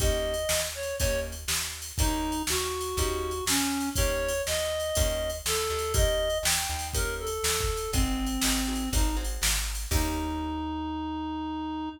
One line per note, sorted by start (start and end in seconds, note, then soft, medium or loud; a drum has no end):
0.00 0.46 D#2 medium
0.00 0.35 A#3 medium
0.00 0.35 C#4 loud
0.00 0.35 D#4 loud
0.00 0.35 G4 loud
0.00 0.61 D#5 loud
0.00 kick loud
0.00 ride loud
0.34 ride medium
0.49 0.94 D#2 medium
0.49 snare loud
0.75 0.96 C#5 medium
0.83 ride medium
0.98 1.45 D#2 medium
0.98 1.35 A#3 medium
0.98 1.35 C#4 loud
0.98 1.35 D#4 loud
0.98 1.35 G4 loud
0.98 1.20 C#5 loud
0.98 kick loud
0.98 ride loud
1.32 ride medium
1.48 1.92 D#2 medium
1.48 snare loud
1.82 ride medium
1.98 2.43 D#2 medium
1.98 2.35 A#3 loud
1.98 2.35 C#4 medium
1.98 2.42 D#4 loud
1.98 2.35 D#4 medium
1.98 2.35 G4 medium
1.98 kick loud
1.98 ride loud
2.32 ride medium
2.47 2.94 D#2 medium
2.47 3.45 F#4 medium
2.47 snare loud
2.81 ride medium
2.97 3.42 D#2 medium
2.97 3.33 A#3 medium
2.97 3.33 C#4 loud
2.97 3.33 D#4 loud
2.97 3.33 G4 loud
2.97 kick medium
2.97 ride loud
3.31 ride medium
3.46 3.91 D#2 medium
3.46 3.89 C#4 loud
3.46 snare loud
3.80 ride medium
3.96 4.42 D#2 medium
3.96 4.33 A#3 loud
3.96 4.33 C#4 loud
3.96 4.33 D#4 medium
3.96 4.33 G4 medium
3.96 4.42 C#5 loud
3.96 kick loud
3.96 ride loud
4.28 ride loud
4.46 4.92 D#2 medium
4.46 5.31 D#5 loud
4.46 snare loud
4.80 ride medium
4.95 5.42 D#2 medium
4.95 5.31 A#3 medium
4.95 5.31 C#4 medium
4.95 5.31 D#4 loud
4.95 5.31 G4 loud
4.95 kick loud
4.95 ride loud
5.30 ride medium
5.46 5.69 D#2 medium
5.46 5.93 A4 loud
5.46 snare loud
5.70 6.39 D#2 medium
5.79 ride medium
5.94 6.29 A#3 medium
5.94 6.29 C#4 loud
5.94 6.29 D#4 loud
5.94 6.29 G4 medium
5.94 6.38 D#5 loud
5.94 kick loud
5.94 ride loud
6.30 ride medium
6.43 6.67 D#2 medium
6.43 6.88 G5 medium
6.43 snare loud
6.70 7.39 D#2 medium
6.79 ride medium
6.93 7.29 A#3 loud
6.93 7.29 C#4 medium
6.93 7.29 D#4 loud
6.93 7.29 G4 medium
6.93 7.15 A#4 loud
6.93 kick loud
6.93 ride loud
7.19 7.91 A4 loud
7.27 ride medium
7.44 7.88 D#2 medium
7.44 snare loud
7.61 kick loud
7.77 ride medium
7.93 8.38 G#1 medium
7.93 8.89 C4 loud
7.93 8.28 C4 loud
7.93 8.28 D#4 medium
7.93 8.28 F#4 medium
7.93 8.28 G#4 loud
7.93 kick loud
7.93 ride loud
8.26 ride medium
8.42 8.88 G#1 medium
8.42 8.61 C4 medium
8.42 8.61 D#4 medium
8.42 8.61 F#4 medium
8.42 8.61 G#4 medium
8.42 snare loud
8.67 8.85 C4 medium
8.67 8.85 D#4 medium
8.67 8.85 F#4 medium
8.67 8.85 G#4 medium
8.75 ride medium
8.93 9.37 G#1 medium
8.93 9.10 C4 medium
8.93 9.10 D#4 loud
8.93 9.16 D#4 medium
8.93 9.10 F#4 medium
8.93 9.10 G#4 medium
8.93 kick loud
8.93 ride loud
9.17 9.51 C4 medium
9.17 9.51 D#4 medium
9.17 9.51 F#4 medium
9.17 9.51 G#4 medium
9.24 ride medium
9.42 9.86 G#1 medium
9.42 snare loud
9.75 ride medium
9.91 11.89 D#2 loud
9.91 11.89 A#3 loud
9.91 11.89 C#4 loud
9.91 11.89 D#4 loud
9.91 11.89 G4 loud
9.91 kick loud
9.91 crash loud